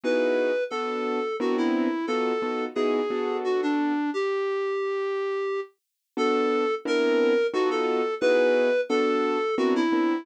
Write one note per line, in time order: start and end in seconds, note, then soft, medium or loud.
0.04 0.51 B3 medium
0.04 0.51 D#4 medium
0.04 0.51 E4 medium
0.04 0.51 F#4 medium
0.04 0.51 G#4 medium
0.04 0.64 B4 medium
0.70 1.19 B3 medium
0.70 1.19 D4 medium
0.70 1.19 F#4 medium
0.70 1.36 A4 medium
0.70 1.19 A4 medium
1.40 1.88 B3 loud
1.40 1.88 C4 loud
1.40 1.88 D4 medium
1.40 1.88 E4 medium
1.40 1.57 F#4 medium
1.40 1.88 A#4 medium
1.58 2.06 E4 medium
2.07 2.32 B3 medium
2.07 2.32 D#4 medium
2.07 2.32 F4 medium
2.07 2.32 F#4 medium
2.07 2.65 A4 loud
2.07 2.32 A4 medium
2.42 2.66 B3 medium
2.42 2.66 D#4 medium
2.42 2.66 F4 medium
2.42 2.66 F#4 medium
2.42 2.66 A4 medium
2.75 3.00 B3 medium
2.75 3.00 D#4 medium
2.75 3.00 E4 medium
2.75 3.00 F#4 medium
2.75 3.37 G#4 medium
2.75 3.00 G#4 medium
3.10 3.92 B3 medium
3.10 3.92 D4 medium
3.10 3.92 F#4 medium
3.10 3.92 A4 medium
3.44 3.61 F#4 medium
3.62 4.10 D4 loud
4.14 5.60 G4 loud
6.17 6.65 B3 medium
6.17 6.65 D4 medium
6.17 6.65 F#4 medium
6.17 6.65 A4 medium
6.17 6.75 A4 loud
6.85 7.33 B3 medium
6.85 7.33 C4 medium
6.85 7.33 D4 medium
6.85 7.33 E4 loud
6.85 7.33 A#4 medium
6.85 7.47 A#4 loud
7.53 8.01 B3 loud
7.53 8.01 D#4 medium
7.53 8.01 F4 medium
7.53 7.70 F#4 loud
7.53 8.01 F#4 medium
7.53 8.01 A4 loud
7.71 8.15 A4 loud
8.21 8.70 B3 medium
8.21 8.70 D#4 medium
8.21 8.70 E4 medium
8.21 8.70 F#4 medium
8.21 8.70 G#4 medium
8.21 8.81 B4 loud
8.89 9.37 B3 medium
8.89 9.37 D4 medium
8.89 9.37 F#4 medium
8.89 9.55 A4 loud
8.89 9.37 A4 loud
9.58 9.82 B3 medium
9.58 9.82 C4 medium
9.58 9.82 D4 loud
9.58 9.82 E4 medium
9.58 9.74 F#4 loud
9.58 9.82 A#4 medium
9.76 10.24 E4 loud
9.92 10.16 B3 medium
9.92 10.16 C4 medium
9.92 10.16 D4 medium
9.92 10.16 E4 medium
9.92 10.16 A#4 medium